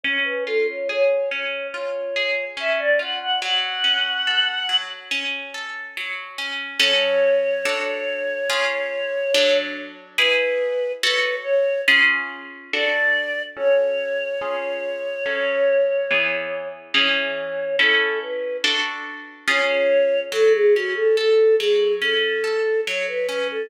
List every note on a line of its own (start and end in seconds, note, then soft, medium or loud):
0.03 1.31 C#4 medium
0.03 0.23 C#5 medium
0.24 0.44 B4 loud
0.46 1.73 F4 medium
0.46 0.66 A4 medium
0.68 0.88 C#5 medium
0.89 2.15 G#4 medium
0.89 1.29 C#5 loud
1.30 2.56 C#4 medium
1.30 1.67 C#5 medium
1.72 2.99 F4 medium
1.72 2.45 C#5 loud
2.16 3.36 G#4 medium
2.57 3.37 C#4 medium
2.57 2.80 E5 loud
2.79 2.99 D5 medium
2.99 3.39 F4 medium
2.99 3.19 F#5 medium
3.20 3.40 F#5 loud
3.41 4.68 F#3 medium
3.41 4.77 F#5 loud
3.84 5.11 C#4 medium
4.27 5.54 A4 medium
4.69 5.96 F#3 medium
5.11 6.38 C#4 medium
5.54 6.75 A4 medium
5.97 6.77 F#3 medium
6.38 6.78 C#4 medium
6.79 7.62 F#3 medium
6.79 7.62 C#4 medium
6.79 7.62 A4 medium
6.79 9.58 C#5 medium
7.65 8.48 D4 medium
7.65 8.48 F#4 medium
7.65 8.48 A4 medium
8.49 9.32 C#4 medium
8.49 9.32 F4 medium
8.49 9.32 G#4 medium
9.34 10.17 F#3 loud
9.34 10.17 D4 medium
9.34 10.17 A4 medium
10.18 11.01 E4 medium
10.18 11.01 G#4 loud
10.18 10.92 B4 loud
10.18 11.01 B4 medium
11.02 11.86 F#4 loud
11.02 11.86 A4 loud
11.02 11.36 B4 medium
11.02 11.86 C#5 medium
11.43 11.81 C#5 medium
11.88 12.71 C#4 loud
11.88 12.71 F4 medium
11.88 12.71 G#4 medium
12.73 13.56 D4 medium
12.73 13.56 F#4 medium
12.73 13.56 A4 loud
12.73 13.42 D5 medium
13.56 14.39 C#4 medium
13.56 14.39 F#4 loud
13.56 14.39 A4 loud
13.56 16.68 C#5 medium
14.41 15.24 C#4 medium
14.41 15.24 F4 medium
14.41 15.24 G#4 medium
15.26 16.08 F#3 medium
15.26 16.08 C#4 medium
15.26 16.08 A4 medium
16.11 16.93 E3 loud
16.11 16.93 B3 medium
16.11 16.93 G#4 medium
16.94 17.77 E3 loud
16.94 17.77 C#4 medium
16.94 17.77 G#4 medium
16.94 17.76 C#5 loud
17.79 18.62 C#4 loud
17.79 18.62 E4 medium
17.79 18.19 A4 medium
17.79 18.62 A4 medium
18.22 18.57 B4 medium
18.64 19.47 D4 medium
18.64 19.47 F#4 medium
18.64 19.47 A4 loud
19.48 20.30 C#4 medium
19.48 20.30 F4 medium
19.48 20.30 G#4 medium
19.48 20.20 C#5 medium
20.32 21.59 F#3 medium
20.32 20.52 A4 loud
20.53 20.73 G#4 medium
20.74 22.01 C#4 medium
20.74 20.94 F#4 loud
20.96 21.16 A4 medium
21.17 22.43 A4 medium
21.17 21.55 A4 medium
21.59 22.87 F#3 medium
21.59 21.93 G#4 loud
22.02 23.28 C#4 medium
22.02 22.81 A4 medium
22.44 23.64 A4 medium
22.86 23.67 F#3 medium
22.86 23.07 C#5 loud
23.08 23.27 B4 medium
23.27 23.69 C#4 medium
23.27 23.47 B4 medium
23.51 23.70 A4 medium